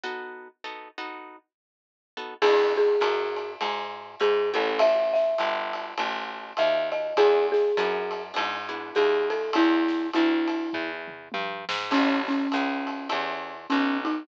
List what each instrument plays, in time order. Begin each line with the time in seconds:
0.03 acoustic guitar (steel) B3 D#4 F#4 A4
0.64 acoustic guitar (steel) B3 D#4 F#4 A4
0.98 acoustic guitar (steel) B3 D#4 F#4 A4
2.17 acoustic guitar (steel) B3 D#4 F#4 A4
2.42 electric bass (finger) E2, acoustic guitar (steel) B3 D4 E4 G#4, marimba G#4, kick, crash, ride
2.76 marimba G#4, snare
3.00 electric bass (finger) F#2, hi-hat pedal, ride
3.36 ride
3.61 electric bass (finger) G#2, ride
4.20 electric bass (finger) G#2, marimba G#4, hi-hat pedal, ride
4.53 electric bass (finger) A1, acoustic guitar (steel) C#4 E4 G4 A4, marimba A4, ride
4.79 marimba E5, kick, ride
5.14 marimba E5, snare
5.38 electric bass (finger) G1, hi-hat pedal, ride
5.73 ride
5.98 electric bass (finger) A1, ride
6.57 electric bass (finger) D#2, marimba E5, hi-hat pedal, ride
6.92 marimba D#5, ride
7.16 electric bass (finger) E2, acoustic guitar (steel) B3 D4 E4 G#4, marimba G#4, kick, ride
7.52 marimba G#4, snare
7.77 electric bass (finger) F#2, acoustic guitar (steel) B3 D4 E4 G#4, hi-hat pedal, ride
8.11 ride
8.34 electric bass (finger) G#2, acoustic guitar (steel) B3 D4 E4 G#4, ride
8.69 acoustic guitar (steel) B3 D4 E4 G#4
8.95 electric bass (finger) D#2, marimba G#4, hi-hat pedal, ride
9.30 marimba A4, ride
9.53 electric bass (finger) E2, marimba E4, ride
9.88 snare
10.13 electric bass (finger) D2, marimba E4, hi-hat pedal, ride
10.48 ride
10.73 electric bass (finger) E2, kick, floor tom
11.07 mid tom
11.32 electric bass (finger) G2, high tom
11.69 electric bass (finger) G#2, snare
11.91 electric bass (finger) A1, acoustic guitar (steel) C#4 E4 G4 A4, marimba C#4, kick, crash, ride
12.28 marimba C#4, snare
12.52 electric bass (finger) C#2, hi-hat pedal, ride
12.87 ride
13.09 electric bass (finger) E2, acoustic guitar (steel) C#4 E4 G4 A4, ride
13.70 electric bass (finger) B1, marimba C#4, hi-hat pedal, ride
14.05 marimba D#4, ride